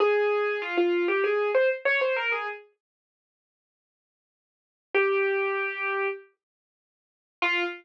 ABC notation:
X:1
M:4/4
L:1/16
Q:1/4=97
K:Fm
V:1 name="Acoustic Grand Piano"
A4 F F2 G A2 c z d c B A | z16 | G8 z8 | F4 z12 |]